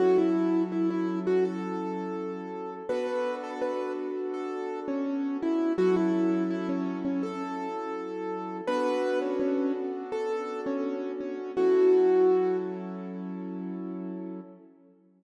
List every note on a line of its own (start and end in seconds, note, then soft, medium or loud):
0.00 2.82 F#3 medium
0.00 2.82 C#4 medium
0.00 2.82 E4 medium
0.00 0.17 F#4 medium
0.00 2.82 A4 medium
0.18 0.63 E4 medium
0.72 0.89 E4 medium
0.90 1.19 E4 medium
1.27 1.44 F#4 medium
1.45 2.74 A4 medium
2.89 5.73 B3 medium
2.89 5.73 D4 medium
2.89 5.73 F#4 medium
2.89 5.73 A4 loud
2.89 3.35 B4 medium
3.44 3.61 A4 medium
3.62 3.92 B4 medium
4.34 4.80 A4 medium
4.88 5.37 C#4 medium
5.42 5.73 E4 medium
5.78 8.61 F#3 loud
5.78 8.61 C#4 medium
5.78 8.61 E4 loud
5.78 5.95 F#4 medium
5.78 8.61 A4 loud
5.96 6.43 E4 medium
6.50 6.68 E4 medium
6.69 6.99 C#4 medium
7.05 7.22 C#4 medium
7.23 8.57 A4 medium
8.67 11.51 B3 loud
8.67 11.51 D4 medium
8.67 11.51 F#4 loud
8.67 11.51 A4 medium
8.67 9.19 B4 loud
9.22 9.39 C#4 medium
9.40 9.72 C#4 medium
10.12 10.61 A4 medium
10.66 11.12 C#4 medium
11.20 11.52 C#4 medium
11.57 14.41 F#3 medium
11.57 14.41 C#4 medium
11.57 14.41 E4 medium
11.57 12.57 F#4 medium
11.57 14.41 A4 medium